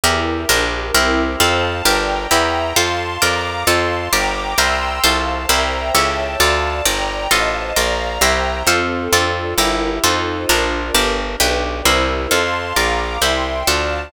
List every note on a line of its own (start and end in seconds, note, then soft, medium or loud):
0.04 0.46 E2 loud
0.04 0.49 E4 medium
0.04 0.48 E4 medium
0.04 0.49 G4 medium
0.04 0.48 G4 medium
0.04 0.49 A#4 medium
0.04 0.48 A#4 medium
0.49 0.91 A#1 loud
0.49 0.94 D4 medium
0.49 0.94 G4 medium
0.49 0.94 A#4 medium
0.94 1.36 C2 medium
0.94 1.39 C4 medium
0.94 1.39 E4 medium
0.94 1.39 G4 medium
0.94 1.39 A#4 medium
1.40 1.82 F2 loud
1.40 1.85 C4 medium
1.40 1.85 F4 medium
1.40 1.85 A4 medium
1.40 1.85 C5 medium
1.40 1.85 F5 medium
1.40 1.85 A5 medium
1.85 2.27 G1 loud
1.85 2.30 D4 medium
1.85 2.30 G4 medium
1.85 2.30 A#4 medium
1.85 2.30 D5 medium
1.85 2.30 G5 medium
1.85 2.30 A#5 medium
2.31 2.73 E2 loud
2.31 2.75 E4 medium
2.31 2.75 G4 medium
2.31 2.75 A#4 medium
2.31 2.76 E5 medium
2.31 2.76 G5 medium
2.31 2.76 A#5 medium
2.76 3.18 F2 loud
2.76 3.21 F4 medium
2.76 3.21 A4 medium
2.76 3.21 C5 medium
2.76 3.21 F5 medium
2.76 3.21 A5 medium
2.76 3.21 C6 medium
3.22 3.64 F2 loud
3.22 3.66 F4 medium
3.22 3.66 A#4 medium
3.22 3.66 D5 medium
3.22 3.67 F5 medium
3.22 3.67 A#5 medium
3.22 3.67 D6 medium
3.67 4.09 F2 loud
3.67 4.12 F4 medium
3.67 4.12 A4 medium
3.67 4.12 C5 medium
3.67 4.12 F5 medium
3.67 4.12 A5 medium
3.67 4.12 C6 medium
4.13 4.54 G1 medium
4.13 4.57 G4 medium
4.13 4.57 A#4 medium
4.13 4.57 D5 medium
4.13 4.58 G5 medium
4.13 4.58 A#5 medium
4.13 4.58 D6 medium
4.58 5.00 C2 loud
4.58 5.03 G4 medium
4.58 5.03 A#4 medium
4.58 5.03 C5 medium
4.58 5.03 E5 medium
4.58 5.03 G5 medium
4.58 5.03 A#5 medium
4.58 5.03 C6 medium
4.58 5.03 E6 medium
5.04 5.46 C2 medium
5.04 5.48 F4 medium
5.04 5.48 A4 medium
5.04 5.49 C5 medium
5.04 5.48 C5 medium
5.04 5.49 F5 medium
5.04 5.49 A5 medium
5.49 5.91 C2 loud
5.49 5.94 E4 medium
5.49 5.94 G4 medium
5.49 5.94 A#4 medium
5.49 5.94 C5 medium
5.49 5.94 E5 medium
5.49 5.94 G5 medium
5.49 5.94 A#5 medium
5.95 6.36 C#2 loud
5.95 6.39 E4 medium
5.95 6.39 G4 medium
5.95 6.39 A4 medium
5.95 6.39 C#5 medium
5.95 6.40 C#5 medium
5.95 6.40 E5 medium
5.95 6.40 G5 medium
5.95 6.40 A5 medium
6.40 6.82 D2 loud
6.40 6.85 F4 medium
6.40 6.85 A4 medium
6.40 6.85 D5 medium
6.40 6.85 F5 medium
6.40 6.85 A5 medium
6.85 7.27 G1 medium
6.85 7.30 G4 medium
6.85 7.30 A#4 medium
6.85 7.30 D5 medium
6.85 7.31 D5 medium
6.85 7.31 G5 medium
6.85 7.31 A#5 medium
7.31 7.73 A1 medium
7.31 7.76 F4 medium
7.31 7.76 A4 medium
7.31 7.76 C5 medium
7.31 7.76 D#5 medium
7.31 7.76 F5 medium
7.31 7.76 A5 medium
7.76 8.19 A#1 loud
7.76 8.21 F4 medium
7.76 8.21 A#4 medium
7.76 8.21 D5 medium
7.76 8.21 F5 medium
7.76 8.21 A#5 medium
8.21 8.63 C2 loud
8.21 8.66 E4 medium
8.21 8.66 G4 medium
8.21 8.66 A#4 medium
8.21 8.67 C5 medium
8.21 8.66 C5 medium
8.21 8.67 E5 medium
8.21 8.67 G5 medium
8.21 8.67 A#5 medium
8.67 9.08 F2 medium
8.67 9.12 C4 medium
8.67 9.12 F4 medium
8.67 9.12 A4 medium
8.67 9.12 C5 medium
9.13 9.54 F2 loud
9.13 9.58 D4 medium
9.13 9.57 F4 medium
9.13 9.58 F4 medium
9.13 9.57 A4 medium
9.13 9.58 A4 medium
9.13 9.57 D5 medium
9.58 9.99 G1 loud
9.58 10.03 E4 medium
9.58 10.03 G4 medium
9.58 10.03 A#4 medium
10.04 10.46 F2 loud
10.04 10.48 D#4 medium
10.04 10.49 D#4 medium
10.04 10.48 F4 medium
10.04 10.48 A4 medium
10.04 10.49 A4 medium
10.04 10.48 C5 medium
10.04 10.49 C5 medium
10.49 10.91 A#1 loud
10.49 10.94 D4 medium
10.49 10.94 F4 medium
10.49 10.94 A#4 medium
10.94 11.36 G1 loud
10.94 11.39 D4 medium
10.94 11.40 D4 medium
10.94 11.39 G4 medium
10.94 11.40 G4 medium
10.94 11.39 A#4 medium
10.94 11.40 A#4 medium
11.40 11.82 B1 loud
11.40 11.84 D4 medium
11.40 11.85 D4 medium
11.40 11.84 G4 medium
11.40 11.85 G4 medium
11.40 11.84 B4 medium
11.40 11.85 B4 medium
11.85 12.27 C2 loud
11.85 12.30 E4 medium
11.85 12.30 G4 medium
11.85 12.30 A#4 medium
11.85 12.30 C5 medium
12.31 12.73 F2 loud
12.31 12.76 F4 medium
12.31 12.76 A4 medium
12.31 12.76 C5 medium
12.31 12.76 F5 medium
12.31 12.76 A5 medium
12.31 12.76 C6 medium
12.76 13.18 A#1 medium
12.76 13.21 F4 medium
12.76 13.21 A#4 medium
12.76 13.21 D5 medium
12.76 13.22 F5 medium
12.76 13.22 A#5 medium
12.76 13.22 D6 medium
13.22 13.63 C2 medium
13.22 13.66 E4 medium
13.22 13.66 G4 medium
13.22 13.66 C5 medium
13.22 13.67 E5 medium
13.22 13.67 G5 medium
13.22 13.67 C6 medium
13.67 14.09 D2 medium
13.67 14.12 D4 medium
13.67 14.12 F4 medium
13.67 14.12 A4 medium
13.67 14.12 D5 medium
13.67 14.12 F5 medium
13.67 14.12 A5 medium